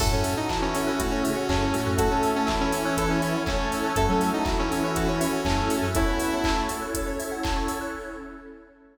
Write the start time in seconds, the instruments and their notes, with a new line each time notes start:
0.00 synth bass 2 F#2, lead 1 (square) A2 A3, electric piano 1 C#4 E4 F#4 A4, pad 2 (warm) C#4 E4 F#4 A4, lead 2 (sawtooth) A4, electric piano 2 A4, kick, crash
0.12 synth bass 2 F#2, lead 2 (sawtooth) C#4, electric piano 2 C#5
0.24 electric piano 2 E5, open hi-hat
0.37 lead 2 (sawtooth) D#4, electric piano 2 F#5
0.49 lead 1 (square) E3 E4, electric piano 2 A5, kick, clap
0.62 lead 2 (sawtooth) C#4, electric piano 2 C#6
0.74 lead 2 (sawtooth) C#4, electric piano 2 E6, open hi-hat
0.87 lead 2 (sawtooth) C#4, electric piano 2 F#6
0.99 lead 1 (square) A2 A3, lead 2 (sawtooth) F#4, electric piano 2 A4, kick, closed hi-hat
1.11 lead 2 (sawtooth) C#4, electric piano 2 C#5
1.23 lead 1 (square) C#3 C#4, lead 2 (sawtooth) C#4, electric piano 2 E5, open hi-hat
1.37 electric piano 2 F#5
1.49 synth bass 2 F#2, lead 2 (sawtooth) C#4, electric piano 2 A5, kick, clap
1.61 electric piano 2 C#6
1.73 lead 1 (square) A2 A3, electric piano 2 E6, open hi-hat
1.86 synth bass 2 F#2, electric piano 2 F#6
1.97 lead 1 (square) A3 A4, electric piano 1 C#4 E4 F#4 A4, pad 2 (warm) C#4 E4 A4 C#5, lead 2 (sawtooth) F#4, electric piano 2 A4, kick, closed hi-hat
2.11 lead 2 (sawtooth) C#4, electric piano 2 C#5
2.23 electric piano 2 E5, open hi-hat
2.35 lead 2 (sawtooth) C#4, electric piano 2 F#5
2.47 lead 1 (square) E3 E4, electric piano 2 A5, kick, clap
2.60 lead 2 (sawtooth) C#4, electric piano 2 C#6
2.72 lead 2 (sawtooth) C#4, electric piano 2 E6, open hi-hat
2.85 lead 2 (sawtooth) C#4, electric piano 2 F#6
2.97 lead 2 (sawtooth) A4, electric piano 2 A4, kick, closed hi-hat
3.10 lead 2 (sawtooth) C#4, electric piano 2 C#5
3.22 lead 2 (sawtooth) C#4, electric piano 2 E5, open hi-hat
3.35 electric piano 2 F#5
3.46 lead 1 (square) A3 A4, lead 2 (sawtooth) C#4, electric piano 2 A5, kick, clap
3.59 electric piano 2 C#6
3.72 electric piano 2 E6, open hi-hat
3.84 electric piano 2 F#6
3.96 synth bass 2 F#2, lead 1 (square) A3 A4, pad 2 (warm) C#4 E4 F#4 A4, electric piano 1 C#4 E4 F#4 A4, lead 2 (sawtooth) A4, electric piano 2 A4, kick, closed hi-hat
4.09 synth bass 2 F#3, lead 2 (sawtooth) C#4, electric piano 2 C#5
4.21 electric piano 2 E5, open hi-hat
4.33 lead 2 (sawtooth) D#4, electric piano 2 F#5
4.45 lead 1 (square) E3 E4, electric piano 2 A5, kick, clap
4.59 lead 2 (sawtooth) C#4, electric piano 2 C#6
4.71 lead 2 (sawtooth) C#4, electric piano 2 E6, open hi-hat
4.83 lead 2 (sawtooth) C#4, electric piano 2 F#6
4.96 lead 2 (sawtooth) F#4, electric piano 2 A4, kick, closed hi-hat
5.08 lead 2 (sawtooth) C#4, electric piano 2 C#5
5.20 lead 2 (sawtooth) C#4, electric piano 2 E5, open hi-hat
5.33 electric piano 2 F#5
5.45 synth bass 2 F#2, lead 1 (square) A3 A4, lead 2 (sawtooth) C#4, electric piano 2 A5, kick, clap
5.58 electric piano 2 C#6
5.70 electric piano 2 E6, open hi-hat
5.82 synth bass 2 F#2, electric piano 2 F#6
5.95 pad 2 (warm) C#4 E4 A4 C#5, lead 1 (square) C#4 C#5, electric piano 1 C#4 E4 F#4 A4, lead 2 (sawtooth) E4, electric piano 2 A4, kick, closed hi-hat
6.07 lead 1 (square) B3 B4, electric piano 2 C#5
6.20 electric piano 2 E5, open hi-hat
6.32 lead 1 (square) A3 A4, electric piano 2 F#5
6.44 electric piano 2 A5, kick, clap
6.57 electric piano 2 C#6
6.69 electric piano 2 E6, open hi-hat
6.82 electric piano 2 F#6
6.95 electric piano 2 A4, kick, closed hi-hat
7.06 electric piano 2 C#5
7.19 electric piano 2 E5, open hi-hat
7.31 electric piano 2 F#5
7.43 electric piano 2 A5, kick, clap
7.56 electric piano 2 C#6
7.68 electric piano 2 E6, open hi-hat
7.81 electric piano 2 F#6